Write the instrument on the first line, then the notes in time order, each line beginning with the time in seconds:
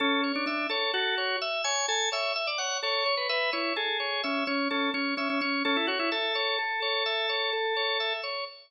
drawbar organ
0.00 C#4 A4
0.24 C#5
0.35 D4
0.46 D4 E5
0.70 A4 C#5
0.94 F#4 A4
1.18 C#5
1.42 E5
1.64 C#5 G#5
1.88 A4 G#5
2.12 C#5 E5
2.36 E5
2.47 D5
2.58 C#5 F#5
2.83 A4 C#5
3.06 C#5
3.17 B4
3.29 B4 E5
3.53 E4 C#5
3.76 G#4 A4
4.00 C#5
4.23 C#4 E5
4.47 C#4 C#5
4.70 C#4 A4
4.94 C#4 C#5
5.17 C#4 E5
5.30 C#4
5.41 C#4 C#5
5.65 C#4 A4
5.77 E4
5.87 F#4 C#5
5.99 E4
6.12 A4 E5
6.35 C#5
6.59 A4
6.82 C#5
7.06 E5
7.29 C#5
7.53 A4
7.77 C#5
8.00 E5
8.23 C#5